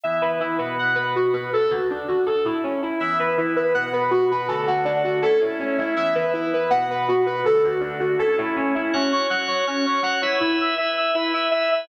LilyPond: <<
  \new Staff \with { instrumentName = "Lead 1 (square)" } { \time 4/4 \key e \mixolydian \tempo 4 = 162 e''8 b'8 e'8 b'8 fis''8 b'8 fis'8 b'8 | a'8 fis'8 d'8 fis'8 a'8 e'8 cis'8 e'8 | e''8 b'8 e'8 b'8 fis''8 b'8 fis'8 b'8 | a'8 fis'8 d'8 fis'8 a'8 e'8 cis'8 e'8 |
e''8 b'8 e'8 b'8 fis''8 b'8 fis'8 b'8 | a'8 fis'8 d'8 fis'8 a'8 e'8 cis'8 e'8 | \key fis \mixolydian cis'8 cis''8 fis''8 cis''8 cis'8 cis''8 fis''8 cis''8 | e'8 e''8 e''8 e''8 e'8 e''8 e''8 e''8 | }
  \new Staff \with { instrumentName = "Drawbar Organ" } { \time 4/4 \key e \mixolydian <e b e'>4. <b, b fis'>2~ <b, b fis'>8 | r1 | <e b e'>2 <b, b fis'>2 | <d a fis'>2 <a cis' e'>2 |
<e b e'>2 <b, b fis'>2 | <d a fis'>2 <a cis' e'>2 | \key fis \mixolydian <fis' cis'' fis''>4 <fis' cis'' fis''>4 <fis' cis'' fis''>4 <fis' cis'' fis''>8 <e' b' e''>8~ | <e' b' e''>4 <e' b' e''>4 <e' b' e''>4 <e' b' e''>4 | }
>>